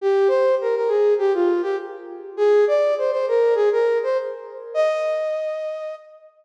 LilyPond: \new Staff { \time 4/4 \key ees \major \tempo 4 = 101 g'8 c''8 bes'16 bes'16 aes'8 g'16 f'8 g'16 r4 | aes'8 d''8 c''16 c''16 bes'8 aes'16 bes'8 c''16 r4 | ees''2~ ees''8 r4. | }